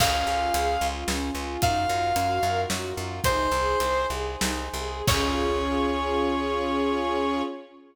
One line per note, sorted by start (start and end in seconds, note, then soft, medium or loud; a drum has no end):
0.00 0.23 C#2 medium
0.00 0.24 C#4 medium
0.00 1.60 C#4 medium
0.00 1.60 F4 medium
0.00 1.60 G#4 medium
0.00 0.87 F5 loud
0.00 kick medium
0.00 crash loud
0.27 0.50 C#2 medium
0.27 0.51 F4 medium
0.54 0.77 C#2 medium
0.54 0.80 G#4 medium
0.54 closed hi-hat medium
0.81 1.04 C#2 medium
0.81 1.07 F4 medium
1.08 1.31 C#2 medium
1.08 1.32 C#4 medium
1.08 snare medium
1.35 1.58 C#2 medium
1.35 1.61 F4 medium
1.61 1.86 F#2 loud
1.61 3.22 D#4 medium
1.61 1.86 D#4 medium
1.61 3.22 F4 medium
1.61 3.22 F#4 medium
1.61 3.22 A#4 medium
1.61 2.61 F5 loud
1.61 kick medium
1.61 closed hi-hat medium
1.89 2.12 F#2 medium
1.89 2.14 F4 medium
2.16 2.39 F#2 medium
2.16 2.40 F#4 medium
2.16 closed hi-hat medium
2.43 2.66 F#2 medium
2.43 2.69 A#4 medium
2.69 2.93 F#2 medium
2.69 2.93 F#4 medium
2.69 snare medium
2.97 3.20 F#2 medium
2.97 3.23 F4 medium
3.23 3.48 C2 medium
3.23 5.04 D#4 medium
3.23 3.50 D#4 loud
3.23 5.04 G#4 loud
3.23 5.04 C5 medium
3.23 4.06 C5 loud
3.23 kick medium
3.23 closed hi-hat loud
3.51 3.76 C2 medium
3.51 3.79 G#4 medium
3.80 4.06 C2 medium
3.80 4.07 C5 medium
3.80 closed hi-hat medium
4.10 4.36 C2 medium
4.10 4.38 G#4 medium
4.40 4.69 C2 medium
4.40 4.69 D#4 medium
4.40 snare loud
4.73 5.02 C2 medium
4.73 5.06 G#4 medium
5.07 7.42 C#2 loud
5.07 7.42 C#4 loud
5.07 7.43 C#4 loud
5.07 7.42 F4 medium
5.07 7.43 F4 medium
5.07 7.42 G#4 loud
5.07 7.43 G#4 medium
5.07 7.42 C#5 loud
5.07 kick loud
5.07 crash loud